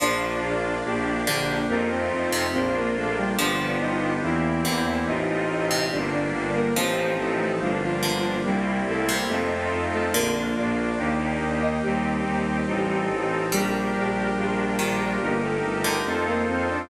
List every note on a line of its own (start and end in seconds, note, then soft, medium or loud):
0.00 0.36 A#1 medium
0.00 1.20 F3 medium
0.00 0.75 A#3 medium
0.00 0.83 A#3 medium
0.00 0.75 D4 medium
0.00 0.83 D4 medium
0.00 1.52 D4 medium
0.00 0.75 F4 medium
0.00 0.83 F4 medium
0.00 1.52 D5 loud
0.42 0.78 A#1 medium
0.85 1.20 A#1 medium
0.85 1.61 A#3 medium
0.85 1.69 A#3 medium
0.85 1.61 D4 medium
0.85 1.69 D4 medium
0.85 1.61 G4 medium
0.85 1.69 G4 medium
1.27 1.62 A#1 medium
1.27 1.66 D3 loud
1.69 2.05 F2 loud
1.69 2.52 A3 medium
1.69 2.46 A3 medium
1.69 1.89 A#3 medium
1.69 2.52 C4 medium
1.69 2.46 C4 medium
1.69 2.52 D#4 medium
1.69 2.46 D#4 medium
1.69 2.51 F4 medium
1.69 2.46 F4 medium
1.69 1.89 A#4 medium
1.90 2.43 C4 medium
1.90 2.43 C5 medium
2.11 2.47 F2 medium
2.32 2.52 C3 medium
2.52 2.89 A#1 loud
2.52 3.36 A#3 medium
2.52 3.29 A#3 medium
2.52 2.74 C4 medium
2.52 3.36 D4 medium
2.52 3.29 D4 medium
2.52 3.36 F4 medium
2.52 3.29 F4 medium
2.52 2.74 C5 medium
2.75 2.95 A#3 medium
2.75 2.95 A#4 medium
2.96 3.32 A#1 medium
2.96 3.16 A3 medium
2.96 3.16 A4 medium
3.17 3.37 G3 medium
3.17 3.37 G4 medium
3.37 3.74 G1 loud
3.37 4.55 F3 loud
3.37 4.14 B3 medium
3.37 4.22 B3 medium
3.37 4.14 D4 medium
3.37 4.22 D4 medium
3.37 3.72 D4 medium
3.37 4.14 F4 medium
3.37 4.22 F4 medium
3.37 4.14 G4 medium
3.37 4.22 G4 medium
3.37 3.72 D5 loud
3.80 4.16 G1 medium
3.80 4.14 D#4 medium
3.80 4.14 D#5 loud
4.22 4.58 E2 medium
4.22 4.84 E3 medium
4.22 4.99 A#3 medium
4.22 5.07 A#3 medium
4.22 4.99 C4 medium
4.22 5.06 C4 medium
4.22 4.99 E4 medium
4.22 4.84 E4 medium
4.22 5.07 E4 medium
4.22 4.99 G4 medium
4.22 5.07 G4 medium
4.65 5.01 E2 medium
4.65 5.05 D3 loud
4.87 5.07 E3 medium
4.87 5.07 E4 medium
5.06 5.43 A1 loud
5.06 5.90 A3 medium
5.06 5.83 A3 medium
5.06 5.90 C4 medium
5.06 5.83 C4 medium
5.06 5.84 D#4 medium
5.06 5.90 D#4 medium
5.06 5.83 D#4 medium
5.06 5.90 F4 medium
5.06 5.83 F4 medium
5.06 5.84 D#5 loud
5.49 5.85 A1 medium
5.71 5.91 C3 medium
5.91 6.28 G1 loud
5.91 6.76 G3 medium
5.91 6.68 G3 medium
5.91 6.76 A#3 medium
5.91 6.68 A#3 medium
5.91 6.11 D4 medium
5.91 6.76 D4 medium
5.91 6.68 D4 medium
5.91 6.11 D5 medium
6.13 6.50 D4 medium
6.13 6.50 D5 medium
6.34 6.70 G1 medium
6.54 6.74 A#3 medium
6.54 6.74 A#4 loud
6.75 7.12 A1 loud
6.75 7.51 F3 medium
6.75 7.60 F3 medium
6.75 7.79 F3 loud
6.75 7.51 A3 medium
6.75 7.60 A3 medium
6.75 7.51 C4 medium
6.75 7.14 C4 medium
6.75 7.60 C4 medium
6.75 7.51 D#4 medium
6.75 7.60 D#4 medium
6.75 7.14 C5 medium
7.18 7.54 A1 medium
7.18 7.38 A3 medium
7.18 7.38 A4 medium
7.39 7.59 A3 medium
7.39 7.59 A4 medium
7.60 7.96 G1 medium
7.60 7.81 F3 medium
7.60 8.44 G3 medium
7.60 8.37 G3 medium
7.60 8.44 A#3 medium
7.60 8.37 A#3 medium
7.60 8.44 D4 medium
7.60 8.37 D4 medium
7.60 7.81 F4 medium
7.82 8.37 F3 medium
7.82 8.37 F4 loud
8.03 8.39 G1 medium
8.03 8.37 D3 medium
8.45 8.81 C2 medium
8.45 8.80 G3 medium
8.45 9.29 G3 medium
8.45 9.22 G3 medium
8.45 9.29 A#3 medium
8.45 9.22 A#3 medium
8.45 9.29 C4 medium
8.45 9.22 C4 medium
8.45 9.29 E4 medium
8.45 9.22 E4 medium
8.45 8.80 G4 medium
8.87 9.23 C2 medium
8.87 9.08 A3 medium
8.87 9.08 A4 medium
9.09 9.29 C3 medium
9.29 9.65 F2 loud
9.29 9.81 A3 medium
9.29 10.06 A3 medium
9.29 10.14 A3 medium
9.29 10.06 C4 medium
9.29 10.14 C4 medium
9.29 10.06 D#4 medium
9.29 10.14 D#4 medium
9.29 10.06 F4 medium
9.29 10.14 F4 medium
9.29 9.81 A4 medium
9.72 10.08 F2 medium
9.93 10.14 A3 medium
9.93 10.14 A4 medium
10.13 10.50 A#1 medium
10.13 11.24 D3 loud
10.13 10.33 A#3 loud
10.13 10.97 A#3 medium
10.13 10.91 A#3 medium
10.13 10.98 D4 medium
10.13 10.91 D4 medium
10.13 10.98 F4 medium
10.13 10.91 F4 medium
10.13 10.33 A#4 loud
10.57 10.92 A#1 loud
10.57 11.44 D4 medium
10.57 11.44 D5 medium
10.98 11.35 D#2 loud
10.98 11.82 A#3 medium
10.98 11.74 A#3 medium
10.98 11.82 D#4 medium
10.98 11.74 D#4 medium
10.98 11.82 G4 medium
10.98 11.74 G4 medium
11.41 11.77 D#2 loud
11.62 11.82 D#4 medium
11.62 11.82 D#5 loud
11.83 12.19 D#2 loud
11.83 13.06 G3 medium
11.83 12.60 C4 medium
11.83 12.66 C4 medium
11.83 12.60 D#4 medium
11.83 12.66 D#4 medium
11.83 13.06 G4 medium
11.83 12.60 G4 medium
11.83 12.68 G4 medium
12.26 12.61 D#2 medium
12.66 13.03 A1 loud
12.66 13.50 C4 medium
12.66 13.43 C4 medium
12.66 13.50 D#4 medium
12.66 13.43 D#4 medium
12.66 13.50 A4 medium
12.66 13.43 A4 medium
13.10 13.46 A1 medium
13.52 13.88 A#1 loud
13.52 14.70 G3 medium
13.52 15.17 G3 loud
13.52 14.28 D4 medium
13.52 14.36 D4 medium
13.52 14.28 G4 medium
13.52 15.17 G4 loud
13.52 14.37 G4 medium
13.52 14.28 A#4 medium
13.52 14.36 A#4 medium
13.94 14.30 A#1 medium
14.37 14.73 A#1 loud
14.37 15.21 D4 medium
14.37 15.13 D4 medium
14.37 15.21 F4 medium
14.37 15.13 F4 medium
14.37 15.20 A#4 medium
14.37 15.13 A#4 medium
14.79 15.15 A#1 medium
14.79 15.18 D#3 medium
15.20 15.57 G1 loud
15.20 15.41 A#3 medium
15.20 16.04 D#4 medium
15.20 15.97 D#4 medium
15.20 16.04 G4 medium
15.20 15.97 G4 medium
15.20 16.04 A#4 medium
15.20 15.97 A#4 medium
15.20 15.41 A#4 loud
15.42 15.94 A3 medium
15.42 15.94 A4 medium
15.63 15.99 G1 medium
15.84 16.04 D3 medium
16.04 16.42 F2 loud
16.04 16.26 A3 medium
16.04 16.88 D#4 medium
16.04 16.82 D#4 medium
16.04 16.88 F4 medium
16.04 16.82 F4 medium
16.04 16.88 A4 medium
16.04 16.26 A4 medium
16.04 16.82 A4 medium
16.04 16.88 C5 medium
16.04 16.82 C5 medium
16.27 16.47 A#3 medium
16.27 16.47 A#4 loud
16.48 16.84 F2 medium
16.48 16.68 C4 medium
16.48 16.68 C5 medium
16.69 16.89 D4 medium
16.69 16.89 D5 medium